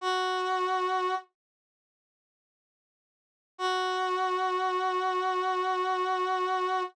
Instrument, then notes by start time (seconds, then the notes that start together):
brass section
0.01 F#4
3.58 F#4